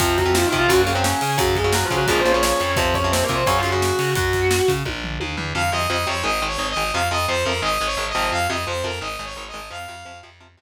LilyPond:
<<
  \new Staff \with { instrumentName = "Distortion Guitar" } { \time 4/4 \key f \phrygian \tempo 4 = 173 <f f'>8 <ges ges'>8 \tuplet 3/2 { <f f'>8 <ees ees'>8 <f f'>8 <ges ges'>8 <bes bes'>8 <c' c''>8 } <des' des''>4 | <ges ges'>8 <aes aes'>8 \tuplet 3/2 { <ges ges'>8 <f f'>8 <ges ges'>8 <aes aes'>8 <c' c''>8 <des' des''>8 } <des' des''>4 | <c' c''>8 <des' des''>8 \tuplet 3/2 { <c' c''>8 <bes bes'>8 <c' c''>8 <des' des''>8 <f' f''>8 <ges' ges''>8 } <ges' ges''>4 | <ges' ges''>4. r2 r8 |
r1 | r1 | r1 | r1 | }
  \new Staff \with { instrumentName = "Lead 2 (sawtooth)" } { \time 4/4 \key f \phrygian r1 | r1 | r1 | r1 |
f''8 ees''8 ees''8 des''8 \tuplet 3/2 { ees''4 des''4 ees''4 } | f''8 ees''8 c''8 bes'8 \tuplet 3/2 { ees''4 des''4 ees''4 } | f''8 ees''8 c''8 bes'8 \tuplet 3/2 { ees''4 des''4 ees''4 } | f''4. r2 r8 | }
  \new Staff \with { instrumentName = "Overdriven Guitar" } { \clef bass \time 4/4 \key f \phrygian <c f>8. <c f>8. <c f>8 <des ges>8 <des ges>16 <des ges>4~ <des ges>16 | <des ges>8. <des ges>8. <des ges>8 <bes, des f>8 <bes, des f>16 <bes, des f>4~ <bes, des f>16 | <c f>8. <c f>8. <c f>8 <des ges>8 <des ges>16 <des ges>4~ <des ges>16 | r1 |
<c f>8 <c f>8 <c f>8 <c f>8 <ees aes>8 <ees aes>8 <ees aes>8 <ees aes>8 | <c f>8 <c f>8 <c f>8 <c f>8 <ees aes>8 <ees aes>8 <ees aes>8 <c f>8~ | <c f>8 <c f>8 <c f>8 <c f>8 <ees aes>8 <ees aes>8 <ees aes>8 <ees aes>8 | <c f>8 <c f>8 <c f>8 <c f>8 <c f>8 <c f>8 r4 | }
  \new Staff \with { instrumentName = "Electric Bass (finger)" } { \clef bass \time 4/4 \key f \phrygian f,4. c8 ges,4. des8 | ges,4. des8 bes,,4. f,8 | f,4. c8 ges,4. des8 | ges,4. des8 bes,,4 ees,8 e,8 |
f,8 f,8 f,8 f,8 aes,,8 aes,,8 aes,,8 aes,,8 | f,8 f,8 f,8 f,8 aes,,8 aes,,8 aes,,8 aes,,8 | f,8 f,8 f,8 f,8 aes,,8 aes,,8 aes,,8 aes,,8 | f,8 f,8 f,8 f,4 f,8 r4 | }
  \new DrumStaff \with { instrumentName = "Drums" } \drummode { \time 4/4 <hh bd>8 <hh bd>8 sn8 <hh bd>8 <hh bd>8 hh8 sn8 hho8 | <hh bd>8 <hh bd>8 sn8 <hh bd>8 <hh bd>8 hh8 sn8 hh8 | <hh bd>8 <hh bd>8 sn8 <hh bd>8 <hh bd>8 hh8 sn8 hho8 | <hh bd>8 <hh bd>8 sn8 <hh bd>8 <bd tommh>8 tomfh8 tommh8 tomfh8 |
r4 r4 r4 r4 | r4 r4 r4 r4 | r4 r4 r4 r4 | r4 r4 r4 r4 | }
>>